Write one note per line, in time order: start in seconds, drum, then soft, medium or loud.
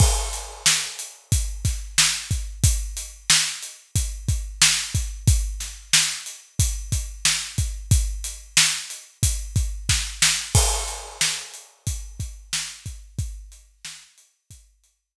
0.00 kick loud
0.00 crash loud
0.33 closed hi-hat medium
0.66 snare loud
0.99 closed hi-hat medium
1.32 kick loud
1.32 closed hi-hat loud
1.65 kick medium
1.65 snare soft
1.65 closed hi-hat medium
1.98 snare loud
2.31 kick medium
2.31 closed hi-hat medium
2.64 kick loud
2.64 closed hi-hat loud
2.97 closed hi-hat medium
3.30 snare loud
3.63 closed hi-hat medium
3.95 kick medium
3.95 closed hi-hat loud
4.28 kick medium
4.28 closed hi-hat medium
4.62 snare loud
4.95 kick medium
4.95 closed hi-hat medium
5.27 kick loud
5.27 closed hi-hat loud
5.60 snare soft
5.60 closed hi-hat medium
5.93 snare loud
6.26 closed hi-hat medium
6.59 kick loud
6.59 closed hi-hat loud
6.92 kick medium
6.92 closed hi-hat medium
7.25 snare loud
7.58 kick medium
7.58 closed hi-hat medium
7.91 kick loud
7.91 closed hi-hat loud
8.24 closed hi-hat medium
8.57 snare loud
8.90 closed hi-hat medium
9.23 kick loud
9.23 closed hi-hat loud
9.56 kick loud
9.56 closed hi-hat medium
9.89 kick medium
9.89 snare loud
10.22 snare loud
10.55 kick loud
10.55 crash loud
10.88 closed hi-hat medium
11.21 snare loud
11.54 closed hi-hat medium
11.87 kick medium
11.87 closed hi-hat loud
12.20 kick medium
12.20 closed hi-hat medium
12.53 snare loud
12.86 kick medium
12.86 closed hi-hat medium
13.19 kick loud
13.19 closed hi-hat loud
13.52 closed hi-hat medium
13.85 snare loud
14.18 closed hi-hat medium
14.50 kick medium
14.50 closed hi-hat loud
14.84 closed hi-hat medium